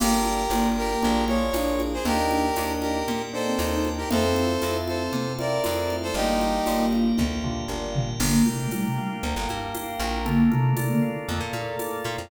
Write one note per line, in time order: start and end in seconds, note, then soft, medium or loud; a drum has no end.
0.00 0.47 G1 medium
0.00 0.41 A#3 medium
0.00 0.44 A#3 medium
0.00 0.41 D4 medium
0.00 0.41 F4 medium
0.00 0.41 G4 medium
0.00 0.69 G4 medium
0.00 0.50 A#4 medium
0.00 0.69 A#4 medium
0.00 0.50 D5 medium
0.00 0.50 F5 medium
0.00 0.50 G5 medium
0.00 crash medium
0.00 low conga medium
0.25 high conga medium
0.50 0.96 G1 medium
0.50 0.92 A#3 medium
0.50 1.42 A#3 medium
0.50 0.92 D4 medium
0.50 0.92 F4 medium
0.50 0.92 G4 medium
0.50 1.02 A#4 medium
0.50 1.02 D5 medium
0.50 1.02 G5 medium
0.50 1.02 A#5 medium
0.50 tambourine medium
0.50 high conga medium
0.77 1.24 G4 medium
0.77 1.24 A#4 medium
1.02 1.50 A#1 medium
1.02 1.23 A#3 medium
1.02 1.23 D4 loud
1.02 1.23 F4 loud
1.02 1.23 G#4 medium
1.02 1.53 A#4 medium
1.02 1.53 D5 medium
1.02 1.53 F5 medium
1.02 1.53 G#5 medium
1.02 low conga medium
1.28 1.49 A#3 medium
1.28 1.49 D4 medium
1.28 1.49 F4 medium
1.28 1.49 G#4 medium
1.28 1.82 C#5 medium
1.28 high conga medium
1.53 1.99 A#1 medium
1.53 1.95 A#3 medium
1.53 1.98 D4 medium
1.53 1.95 D4 medium
1.53 1.95 F4 medium
1.53 1.95 G#4 medium
1.53 2.04 A#4 medium
1.53 2.04 D5 medium
1.53 2.05 G#5 medium
1.53 2.05 A#5 medium
1.53 tambourine medium
1.53 high conga medium
1.80 high conga medium
1.93 2.05 G#4 medium
1.93 2.05 C5 medium
2.05 2.51 D#2 loud
2.05 2.46 A#3 medium
2.05 2.29 A#3 medium
2.05 2.46 D4 medium
2.05 2.46 D#4 medium
2.05 2.46 G4 medium
2.05 2.73 G4 medium
2.05 3.07 A#4 medium
2.05 2.73 A#4 loud
2.05 3.07 D5 medium
2.05 3.07 D#5 medium
2.05 3.07 G5 medium
2.05 low conga medium
2.31 3.03 D4 medium
2.31 high conga medium
2.56 3.03 D#2 medium
2.56 2.97 A#3 medium
2.56 2.97 D4 medium
2.56 2.97 D#4 medium
2.56 2.97 G4 medium
2.56 tambourine medium
2.56 high conga medium
2.81 3.22 G4 medium
2.81 3.22 A#4 medium
2.81 high conga medium
3.08 3.54 A#2 medium
3.08 4.10 A#4 medium
3.08 4.10 D5 medium
3.08 4.10 G5 medium
3.08 4.10 A#5 medium
3.08 low conga medium
3.33 3.54 A#3 medium
3.33 3.54 D4 medium
3.33 3.54 D#4 medium
3.33 3.54 G4 medium
3.33 3.89 A4 medium
3.33 3.89 C5 medium
3.46 3.58 C4 medium
3.59 4.05 D#2 medium
3.59 4.00 A#3 medium
3.59 4.00 D4 medium
3.59 4.00 D#4 medium
3.59 4.00 G4 medium
3.59 tambourine medium
3.59 high conga medium
3.71 3.96 D#4 medium
3.85 high conga medium
3.97 4.10 D#4 medium
3.97 4.09 G4 medium
3.97 4.09 A#4 medium
4.10 4.58 F2 medium
4.10 4.51 A3 medium
4.10 5.34 C4 medium
4.10 4.51 C4 medium
4.10 4.51 E4 medium
4.10 4.51 F4 medium
4.10 5.12 A4 medium
4.10 4.77 A4 medium
4.10 5.12 C5 medium
4.10 4.77 C5 medium
4.10 5.12 E5 medium
4.10 5.12 F5 medium
4.10 low conga medium
4.36 high conga medium
4.62 5.09 F2 medium
4.62 5.03 A3 medium
4.62 5.03 C4 medium
4.62 5.03 E4 medium
4.62 5.03 F4 medium
4.62 tambourine medium
4.62 high conga medium
4.88 5.33 A4 medium
4.88 5.33 C5 medium
4.88 high conga medium
5.12 5.59 C3 medium
5.12 6.14 A4 medium
5.12 6.14 C5 medium
5.12 6.14 F5 medium
5.12 6.14 A5 medium
5.12 low conga medium
5.38 5.59 A3 medium
5.38 5.59 C4 medium
5.38 5.59 E4 medium
5.38 5.59 F4 medium
5.38 5.96 A#4 medium
5.38 5.96 D5 medium
5.38 high conga medium
5.64 6.12 F2 medium
5.64 6.07 A3 medium
5.64 6.05 A3 medium
5.64 6.05 C4 medium
5.64 6.05 E4 medium
5.64 6.05 F4 medium
5.64 tambourine medium
5.64 high conga medium
5.90 high conga medium
6.02 6.15 A4 medium
6.02 6.15 C5 medium
6.14 6.60 G1 loud
6.14 6.57 G3 medium
6.14 7.24 A#3 medium
6.14 6.57 A#3 medium
6.14 6.57 D4 medium
6.14 6.86 D#4 medium
6.14 6.57 F4 medium
6.14 6.86 G4 medium
6.14 7.17 G4 medium
6.14 7.17 A#4 medium
6.14 7.18 D5 medium
6.14 7.17 F5 medium
6.41 high conga medium
6.66 7.13 G1 medium
6.66 7.07 G3 medium
6.66 7.07 A#3 medium
6.66 7.07 D4 medium
6.66 7.07 F4 medium
6.66 tambourine medium
6.66 high conga medium
6.93 high conga medium
7.17 7.65 D2 medium
7.17 8.19 G4 medium
7.17 8.19 A#4 medium
7.17 8.19 F5 medium
7.17 8.19 G5 medium
7.17 kick medium
7.17 high tom medium
7.44 7.64 G3 medium
7.44 7.64 A#3 medium
7.44 7.64 D4 medium
7.44 7.64 F4 medium
7.44 floor tom medium
7.68 8.14 G1 medium
7.68 8.10 G3 medium
7.68 8.10 A#3 medium
7.68 8.10 D4 medium
7.68 8.10 F4 medium
7.95 floor tom loud
8.20 8.43 G1 loud
8.20 8.45 D3 medium
8.20 8.45 A#3 loud
8.20 9.22 A#3 medium
8.20 9.22 D4 loud
8.20 9.22 F4 medium
8.20 9.22 G4 medium
8.20 8.71 A#4 medium
8.20 crash medium
8.20 low conga medium
8.46 8.67 C3 medium
8.46 8.67 A3 medium
8.46 9.48 G5 medium
8.46 high conga medium
8.71 8.85 A#2 medium
8.71 8.85 G3 medium
8.71 9.22 A#4 medium
8.71 tambourine medium
8.71 high conga medium
8.85 8.97 C3 medium
8.85 8.97 A3 medium
8.98 9.74 F5 medium
9.23 9.35 D2 medium
9.23 10.25 A#3 medium
9.23 10.25 D4 medium
9.23 10.25 G4 medium
9.23 9.99 A#4 medium
9.23 10.25 A#4 medium
9.23 low conga medium
9.36 9.48 G1 medium
9.49 9.73 G2 medium
9.49 10.22 G5 medium
9.49 high conga medium
9.74 10.23 F5 medium
9.74 tambourine medium
9.74 high conga medium
9.99 10.48 A#1 loud
9.99 10.24 A#4 medium
9.99 high conga medium
10.25 10.50 D3 loud
10.25 11.27 A3 medium
10.25 11.27 A#3 medium
10.25 10.50 A#3 loud
10.25 11.27 D4 medium
10.25 11.27 F4 medium
10.25 11.28 A4 medium
10.25 low conga medium
10.51 10.73 C3 medium
10.51 10.73 A3 loud
10.51 11.53 A#4 medium
10.51 high conga medium
10.77 10.89 C3 medium
10.77 10.89 A3 medium
10.77 11.79 D5 medium
10.77 tambourine medium
10.77 high conga medium
10.90 11.02 D3 medium
10.90 11.02 A#3 medium
11.02 12.05 F5 medium
11.28 11.40 F2 medium
11.28 12.29 A3 medium
11.28 12.29 A#3 medium
11.28 12.29 F4 medium
11.28 12.29 A4 medium
11.28 12.26 A4 medium
11.28 low conga medium
11.40 11.52 A#2 medium
11.53 11.76 A#2 medium
11.53 12.27 A#4 medium
11.53 high conga medium
11.79 12.28 D5 medium
11.79 tambourine medium
11.79 high conga medium
12.04 12.17 A#2 medium
12.04 12.29 F5 medium
12.04 high conga medium
12.18 12.30 F2 medium